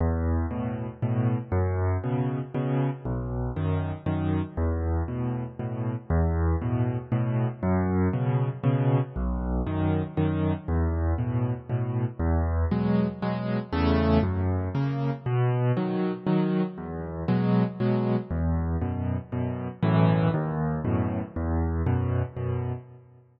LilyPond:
\new Staff { \time 3/4 \key e \major \tempo 4 = 118 e,4 <a, b,>4 <a, b,>4 | fis,4 <b, cis>4 <b, cis>4 | b,,4 <fis, dis>4 <fis, dis>4 | e,4 <a, b,>4 <a, b,>4 |
e,4 <a, b,>4 <a, b,>4 | fis,4 <b, cis>4 <b, cis>4 | b,,4 <fis, dis>4 <fis, dis>4 | e,4 <a, b,>4 <a, b,>4 |
e,4 <b, fis gis>4 <b, fis gis>4 | <e, cis a>4 fis,4 <cis ais>4 | b,4 <dis fis>4 <dis fis>4 | e,4 <b, fis gis>4 <b, fis gis>4 |
e,4 <fis, b,>4 <fis, b,>4 | <b,, fis, a, e>4 dis,4 <fis, a, b,>4 | e,4 <fis, b,>4 <fis, b,>4 | }